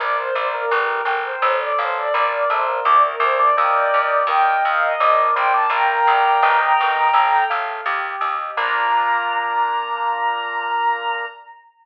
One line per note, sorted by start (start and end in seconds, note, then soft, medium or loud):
0.00 0.31 A#1 loud
0.00 0.17 A#3 loud
0.00 0.68 A#4 medium
0.00 0.16 D5 loud
0.17 0.34 C5 loud
0.35 0.66 A#1 loud
0.35 0.52 C5 medium
0.35 0.70 D5 medium
0.53 0.71 A#3 loud
0.53 1.13 A#4 loud
0.71 1.02 G1 loud
0.71 1.02 G3 loud
0.71 1.39 A#4 medium
1.05 1.36 G1 loud
1.05 1.41 G5 medium
1.24 1.58 C5 medium
1.42 1.72 A1 loud
1.42 2.11 A4 loud
1.60 1.77 D5 loud
1.78 2.09 A1 loud
1.78 1.96 C5 loud
1.78 2.13 F5 medium
1.97 2.13 D5 loud
2.14 2.44 A#1 loud
2.14 2.45 A#3 medium
2.14 2.82 A#4 medium
2.14 2.31 D5 loud
2.31 2.48 D5 medium
2.50 2.80 A#1 medium
2.50 2.67 A3 loud
2.50 2.79 C5 loud
2.50 2.84 D5 medium
2.68 2.85 A#3 medium
2.85 3.16 D2 loud
2.85 3.03 D4 loud
2.85 3.54 A#4 medium
2.85 3.02 D5 loud
3.04 3.21 A#4 medium
3.20 3.50 D2 loud
3.20 3.40 C5 loud
3.20 3.55 D5 medium
3.39 3.56 D4 loud
3.39 4.26 D5 loud
3.57 3.88 D#2 loud
3.57 3.90 A#3 medium
3.57 4.21 A#4 medium
3.57 4.21 D#5 medium
3.57 4.21 G5 loud
3.94 4.24 D#2 medium
4.27 4.57 D#2 loud
4.27 4.93 A#4 medium
4.27 4.93 D#5 loud
4.27 4.93 G5 medium
4.27 4.63 G5 loud
4.65 4.95 D#2 loud
4.65 4.83 F5 loud
4.81 5.26 D#5 loud
5.00 5.31 A#1 loud
5.00 5.34 D4 loud
5.00 5.68 A#4 medium
5.35 5.67 A#1 loud
5.35 5.53 C4 loud
5.35 5.70 D5 medium
5.35 5.52 G5 loud
5.54 5.71 D4 loud
5.54 5.71 A5 loud
5.70 6.00 A#1 loud
5.70 6.60 A#3 loud
5.70 6.39 A#4 medium
5.70 7.44 G5 medium
5.70 7.44 A#5 loud
6.07 6.38 A#1 loud
6.07 6.41 D5 medium
6.43 6.73 G1 loud
6.43 7.07 A#4 medium
6.43 7.07 D#5 loud
6.43 7.07 G5 medium
6.81 7.11 G1 loud
7.13 7.44 A1 loud
7.13 7.82 A4 medium
7.50 7.81 A1 medium
7.50 7.84 F5 medium
7.86 8.16 D#2 loud
7.86 8.54 G4 medium
8.21 8.51 D#2 medium
8.21 8.55 D#5 medium
8.57 11.26 A#1 loud
8.57 11.26 A#3 loud
8.57 11.26 D4 loud
8.57 11.26 F4 loud
8.57 11.25 A#5 loud